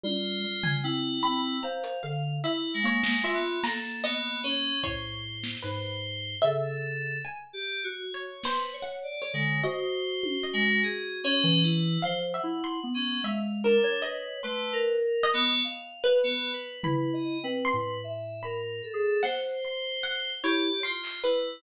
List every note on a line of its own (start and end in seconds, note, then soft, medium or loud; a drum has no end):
0.04 0.40 G3 loud
0.04 0.76 F4 medium
0.04 high tom medium
0.43 0.80 G3 medium
0.64 1.18 G#5 medium
0.64 floor tom medium
0.83 1.20 C4 medium
0.83 1.56 E4 loud
1.23 1.59 C4 loud
1.23 1.59 B5 loud
1.63 2.00 C5 medium
1.63 2.35 F5 loud
1.63 1.99 A#5 medium
1.83 closed hi-hat loud
2.03 2.40 D3 loud
2.03 2.39 F5 medium
2.44 2.71 E4 medium
2.44 2.79 E4 medium
2.44 2.80 E5 medium
2.74 3.01 G#3 medium
2.83 3.20 A#3 medium
2.83 3.21 C#5 medium
3.04 3.31 G#3 medium
3.04 snare loud
3.23 3.60 F4 loud
3.23 3.60 E5 loud
3.33 3.60 B3 medium
3.64 4.71 A#3 medium
3.64 4.00 A4 medium
3.64 4.00 A#5 medium
3.64 snare medium
4.03 4.39 B3 medium
4.03 4.40 D#5 loud
4.43 4.79 C#4 medium
4.43 4.80 C#5 medium
4.83 5.55 A2 medium
4.83 5.55 C5 soft
4.83 5.55 C#5 loud
4.83 kick medium
5.44 snare medium
5.62 6.36 G#2 medium
5.62 6.34 B4 soft
5.62 6.36 C5 medium
6.42 7.16 C#3 medium
6.42 7.16 A4 medium
6.42 7.14 E5 loud
7.25 7.79 G#5 medium
7.53 7.80 G4 medium
7.84 8.11 F#4 loud
8.14 8.41 C#5 medium
8.44 8.71 B4 medium
8.44 8.81 C5 loud
8.44 snare medium
8.73 9.01 C#5 loud
8.83 9.19 F#5 medium
9.03 9.30 D5 medium
9.22 9.58 C#5 medium
9.34 9.61 D3 medium
9.34 9.61 G#3 medium
9.63 11.26 F#4 loud
9.63 10.45 C5 medium
9.63 10.36 D#5 medium
10.23 high tom medium
10.44 11.15 D#5 medium
10.53 10.80 G#3 loud
10.83 11.19 G#4 medium
11.24 11.60 C#4 loud
11.24 11.96 C#5 medium
11.44 11.97 E3 loud
11.63 12.00 E4 medium
12.02 12.39 F3 medium
12.02 12.31 C5 loud
12.02 12.29 F5 medium
12.33 12.61 E5 medium
12.33 12.87 F#5 medium
12.44 12.79 E4 medium
12.64 12.91 C6 medium
12.84 13.20 B3 medium
12.94 13.21 C#4 medium
13.23 13.78 G#3 medium
13.23 13.60 E5 medium
13.23 13.60 F5 medium
13.64 14.00 D4 medium
13.64 14.00 A#4 medium
13.84 14.38 C#5 medium
13.84 cowbell medium
14.02 14.39 B4 medium
14.02 14.38 D#5 medium
14.43 14.71 A3 medium
14.43 14.97 B4 medium
14.43 15.15 C6 medium
14.73 15.27 A#4 loud
15.23 15.96 D#5 loud
15.34 15.61 B3 loud
15.64 16.18 F5 medium
16.04 16.76 B4 medium
16.23 16.50 B3 medium
16.53 16.80 B4 medium
16.84 17.38 E4 loud
16.84 17.11 B4 medium
16.84 17.56 B5 medium
16.84 floor tom medium
17.13 17.40 D#5 medium
17.43 17.71 C4 medium
17.43 17.98 B4 loud
17.65 18.37 C6 medium
17.73 18.82 A2 medium
18.04 18.40 E5 medium
18.43 18.80 A#4 medium
18.43 19.15 B5 medium
18.83 19.19 A4 medium
18.93 19.21 G#4 medium
19.23 20.31 C5 loud
19.23 19.59 F#5 medium
19.23 snare medium
19.64 20.00 C6 medium
20.03 20.39 F#5 medium
20.43 20.71 E4 loud
20.43 20.80 G4 loud
20.43 20.80 C#5 medium
20.83 21.20 F4 medium
20.83 21.19 C6 loud
21.04 clap medium
21.23 21.59 E4 medium
21.23 21.59 B4 medium